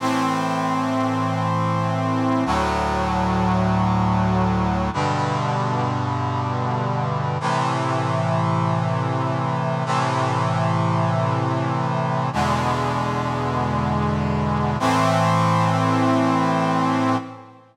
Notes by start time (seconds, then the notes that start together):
0.00 A2 E3 C4
2.46 D2 A2 F#3
4.93 G2 B2 D3
7.40 A2 C3 E3
9.85 A2 C3 E3
12.33 E2 B2 D3 G#3
14.79 A2 E3 C4